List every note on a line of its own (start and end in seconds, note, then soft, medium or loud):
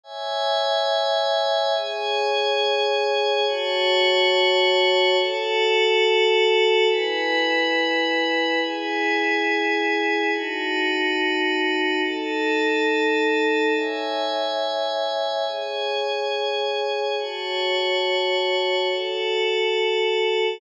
0.04 1.73 C#5 medium
0.04 1.73 E5 medium
0.04 1.73 G#5 medium
1.75 3.45 G#4 medium
1.75 3.45 C#5 medium
1.75 3.45 G#5 medium
3.46 5.16 F#4 loud
3.46 5.16 C#5 loud
3.46 5.16 A5 loud
5.18 6.88 F#4 medium
5.18 6.88 A4 medium
5.18 6.88 A5 medium
6.89 8.59 E4 medium
6.89 8.59 B4 medium
6.89 8.59 G#5 medium
8.61 10.30 E4 medium
8.61 10.30 G#4 medium
8.61 10.30 G#5 medium
10.32 12.02 D#4 medium
10.32 12.02 F#4 medium
10.32 12.02 A5 medium
12.04 13.73 D#4 medium
12.04 13.73 A4 medium
12.04 13.73 A5 medium
13.75 15.45 C#5 medium
13.75 15.45 E5 medium
13.75 15.45 G#5 medium
15.46 17.16 G#4 medium
15.46 17.16 C#5 medium
15.46 17.16 G#5 medium
17.18 18.88 F#4 medium
17.18 18.88 C#5 medium
17.18 18.88 A5 medium
18.89 20.59 F#4 medium
18.89 20.59 A4 medium
18.89 20.59 A5 medium